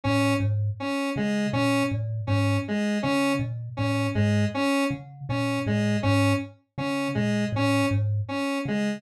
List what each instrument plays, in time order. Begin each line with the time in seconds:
0.04 kalimba A2, lead 1 (square) C#4
0.40 kalimba G#2
0.80 lead 1 (square) C#4
1.16 kalimba C#3, lead 1 (square) G#3
1.53 kalimba A#2, lead 1 (square) C#4
1.91 kalimba A2
2.27 kalimba G#2, lead 1 (square) C#4
2.68 lead 1 (square) G#3
3.03 kalimba C#3, lead 1 (square) C#4
3.39 kalimba A#2
3.77 kalimba A2, lead 1 (square) C#4
4.15 kalimba G#2, lead 1 (square) G#3
4.54 lead 1 (square) C#4
4.91 kalimba C#3
5.29 kalimba A#2, lead 1 (square) C#4
5.66 kalimba A2, lead 1 (square) G#3
6.03 kalimba G#2, lead 1 (square) C#4
6.78 kalimba C#3, lead 1 (square) C#4
7.15 kalimba A#2, lead 1 (square) G#3
7.52 kalimba A2, lead 1 (square) C#4
7.91 kalimba G#2
8.28 lead 1 (square) C#4
8.65 kalimba C#3, lead 1 (square) G#3